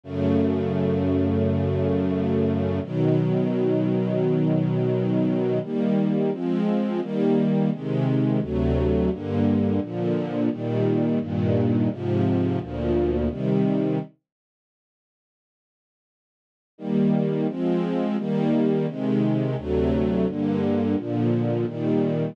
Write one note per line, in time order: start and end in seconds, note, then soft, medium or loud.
0.03 2.80 F#2 medium
0.03 2.80 C#3 medium
0.03 2.80 A3 medium
2.83 5.59 B2 medium
2.83 5.59 D#3 medium
2.83 5.59 F#3 medium
5.62 6.31 D#3 medium
5.62 6.31 G3 medium
5.62 6.31 A#3 medium
6.31 7.00 F3 medium
6.31 7.00 G#3 medium
6.31 7.00 C4 medium
7.01 7.70 D#3 medium
7.01 7.70 G3 medium
7.01 7.70 A#3 medium
7.71 8.40 C3 medium
7.71 8.40 D#3 medium
7.71 8.40 G#3 medium
8.41 9.10 D2 medium
8.41 9.10 C3 medium
8.41 9.10 F#3 medium
8.41 9.10 A3 medium
9.10 9.80 G2 medium
9.10 9.80 D3 medium
9.10 9.80 A#3 medium
9.80 10.49 A#2 medium
9.80 10.49 D3 medium
9.80 10.49 F3 medium
10.50 11.19 A#2 medium
10.50 11.19 D#3 medium
10.50 11.19 G3 medium
11.20 11.89 G2 medium
11.20 11.89 A#2 medium
11.20 11.89 D#3 medium
11.90 12.59 G#2 medium
11.90 12.59 C3 medium
11.90 12.59 F3 medium
12.59 13.28 D2 medium
12.59 13.28 A#2 medium
12.59 13.28 F3 medium
13.29 13.98 C3 medium
13.29 13.98 D#3 medium
13.29 13.98 G3 medium
16.78 17.47 D#3 medium
16.78 17.47 G3 medium
16.78 17.47 A#3 medium
17.48 18.17 F3 medium
17.48 18.17 G#3 medium
17.48 18.17 C4 medium
18.17 18.86 D#3 medium
18.17 18.86 G3 medium
18.17 18.86 A#3 medium
18.87 19.56 C3 medium
18.87 19.56 D#3 medium
18.87 19.56 G#3 medium
19.57 20.26 D2 medium
19.57 20.26 C3 medium
19.57 20.26 F#3 medium
19.57 20.26 A3 medium
20.27 20.96 G2 medium
20.27 20.96 D3 medium
20.27 20.96 A#3 medium
20.97 21.66 A#2 medium
20.97 21.66 D3 medium
20.97 21.66 F3 medium
21.66 22.35 A#2 medium
21.66 22.35 D#3 medium
21.66 22.35 G3 medium